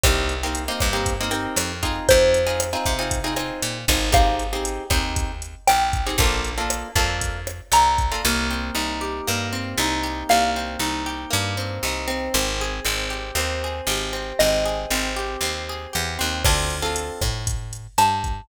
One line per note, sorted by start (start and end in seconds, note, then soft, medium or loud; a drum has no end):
0.04 0.69 C2 medium
0.04 0.34 A#3 medium
0.04 0.34 C4 medium
0.04 0.34 D#4 medium
0.04 0.34 G4 medium
0.04 kick loud
0.04 cross-stick loud
0.04 closed hi-hat loud
0.29 closed hi-hat medium
0.43 0.64 A#3 medium
0.43 0.64 C4 medium
0.43 0.64 D#4 medium
0.43 0.64 G4 medium
0.55 closed hi-hat medium
0.68 0.89 A#3 medium
0.68 0.89 C4 medium
0.68 0.89 D#4 medium
0.68 0.89 G4 medium
0.80 1.47 G2 medium
0.80 kick medium
0.80 cross-stick medium
0.80 closed hi-hat medium
0.93 1.14 A#3 medium
0.93 1.14 C4 medium
0.93 1.14 D#4 medium
0.93 1.14 G4 medium
1.06 kick medium
1.06 closed hi-hat loud
1.21 1.31 A#3 medium
1.21 1.31 C4 medium
1.21 1.31 D#4 medium
1.21 1.31 G4 medium
1.31 1.72 A#3 medium
1.31 1.72 C4 medium
1.31 1.72 D#4 medium
1.31 1.72 G4 medium
1.31 closed hi-hat medium
1.56 2.00 F2 medium
1.56 cross-stick loud
1.56 closed hi-hat loud
1.83 2.39 C4 medium
1.83 2.39 D#4 medium
1.83 2.39 F4 medium
1.83 2.39 G#4 medium
1.83 kick medium
1.83 closed hi-hat medium
2.09 2.76 F2 loud
2.09 4.04 C5 medium
2.09 kick medium
2.09 closed hi-hat loud
2.34 closed hi-hat medium
2.47 2.67 C4 medium
2.47 2.67 D#4 medium
2.47 2.67 F4 medium
2.47 2.67 G#4 medium
2.60 cross-stick medium
2.60 closed hi-hat loud
2.73 2.93 C4 medium
2.73 2.93 D#4 medium
2.73 2.93 F4 medium
2.73 2.93 G#4 medium
2.86 3.51 C3 medium
2.86 kick medium
2.86 closed hi-hat medium
2.99 3.19 C4 medium
2.99 3.19 D#4 medium
2.99 3.19 F4 medium
2.99 3.19 G#4 medium
3.11 kick medium
3.11 closed hi-hat loud
3.24 3.34 C4 medium
3.24 3.34 D#4 medium
3.24 3.34 F4 medium
3.24 3.34 G#4 medium
3.36 3.77 C4 medium
3.36 3.77 D#4 medium
3.36 3.77 F4 medium
3.36 3.77 G#4 medium
3.36 cross-stick medium
3.36 closed hi-hat medium
3.62 3.85 A#2 medium
3.62 closed hi-hat loud
3.88 4.79 G#1 loud
3.88 4.10 C4 medium
3.88 4.10 D#4 medium
3.88 4.10 F4 medium
3.88 4.10 G#4 medium
3.88 kick medium
3.88 closed hi-hat medium
4.12 4.43 C4 medium
4.12 4.43 D#4 medium
4.12 4.43 G4 medium
4.12 4.43 G#4 medium
4.12 5.53 F5 medium
4.12 kick loud
4.12 cross-stick loud
4.12 closed hi-hat loud
4.39 closed hi-hat medium
4.53 4.84 C4 medium
4.53 4.84 D#4 medium
4.53 4.84 G4 medium
4.53 4.84 G#4 medium
4.65 closed hi-hat loud
4.90 5.55 D#2 medium
4.90 5.32 C4 medium
4.90 5.32 D#4 medium
4.90 5.32 G4 medium
4.90 5.32 G#4 medium
4.90 kick medium
4.90 cross-stick medium
4.90 closed hi-hat medium
5.16 kick medium
5.16 closed hi-hat loud
5.42 closed hi-hat medium
5.67 6.12 A#1 medium
5.67 6.18 G5 medium
5.67 cross-stick loud
5.67 closed hi-hat loud
5.93 kick medium
5.93 closed hi-hat medium
6.07 6.17 C4 medium
6.07 6.17 D#4 medium
6.07 6.17 G4 medium
6.07 6.17 G#4 medium
6.18 6.83 A#1 medium
6.18 6.51 A#3 medium
6.18 6.51 D4 medium
6.18 6.51 F4 medium
6.18 6.51 A4 medium
6.18 kick loud
6.18 closed hi-hat medium
6.45 closed hi-hat medium
6.58 6.88 A#3 medium
6.58 6.88 D4 medium
6.58 6.88 F4 medium
6.58 6.88 A4 medium
6.70 cross-stick medium
6.70 closed hi-hat loud
6.96 7.61 F2 medium
6.96 7.37 A#3 medium
6.96 7.37 D4 medium
6.96 7.37 F4 medium
6.96 7.37 A4 medium
6.96 kick medium
6.96 closed hi-hat medium
7.21 kick medium
7.21 closed hi-hat loud
7.47 cross-stick medium
7.47 closed hi-hat medium
7.72 8.15 C2 medium
7.72 8.24 A#5 medium
7.72 closed hi-hat loud
7.98 kick medium
7.98 closed hi-hat medium
8.12 8.22 A#3 medium
8.12 8.22 D4 medium
8.12 8.22 F4 medium
8.12 8.22 A4 medium
8.25 8.71 C2 medium
8.25 9.27 A#3 loud
8.51 9.52 C4 medium
8.75 9.21 C2 medium
8.75 9.79 D#4 medium
9.01 10.03 G4 medium
9.27 9.74 G2 medium
9.27 10.29 A#3 medium
9.53 10.56 C4 medium
9.78 10.24 C2 medium
9.78 10.80 D#4 medium
10.03 11.06 G4 medium
10.29 10.77 C2 medium
10.29 11.30 A#3 medium
10.29 12.28 F5 medium
10.56 11.57 C4 medium
10.79 11.26 C2 medium
10.79 11.84 D#4 medium
11.06 12.28 G4 medium
11.31 11.79 G2 medium
11.31 12.28 A#3 medium
11.57 12.07 C4 medium
11.83 12.29 C2 medium
11.83 12.33 D#4 medium
12.08 12.84 C4 loud
12.34 12.80 G#1 loud
12.61 13.63 G#4 medium
12.85 13.32 G#1 medium
12.85 13.36 C4 medium
13.10 13.88 G4 medium
13.35 13.81 D#2 medium
13.35 14.12 C4 medium
13.64 14.65 G#4 medium
13.87 14.33 G#1 medium
13.87 15.16 G4 medium
14.13 14.40 C4 medium
14.39 14.86 G#1 medium
14.39 14.91 C4 medium
14.39 16.43 D#5 medium
14.65 15.69 G#4 medium
14.90 15.37 G#1 medium
14.90 15.42 C4 medium
15.16 15.93 G4 medium
15.41 15.87 D#2 medium
15.41 16.18 C4 medium
15.69 16.42 G#4 medium
15.93 16.18 E2 medium
15.93 16.42 G4 medium
16.19 16.44 D#2 medium
16.19 16.43 C4 medium
16.45 17.11 D2 medium
16.45 16.76 C4 medium
16.45 16.76 D4 medium
16.45 16.76 F4 medium
16.45 16.76 A4 medium
16.45 kick loud
16.45 cross-stick loud
16.45 crash medium
16.70 closed hi-hat medium
16.82 17.23 C4 medium
16.82 17.23 D4 medium
16.82 17.23 F4 medium
16.82 17.23 A4 medium
16.96 closed hi-hat loud
17.21 17.87 A2 medium
17.21 kick medium
17.21 cross-stick medium
17.21 closed hi-hat medium
17.47 kick medium
17.47 closed hi-hat loud
17.73 closed hi-hat medium
17.98 18.41 G2 medium
17.98 18.48 A5 medium
17.98 cross-stick medium
17.98 closed hi-hat loud
18.24 kick medium
18.24 closed hi-hat medium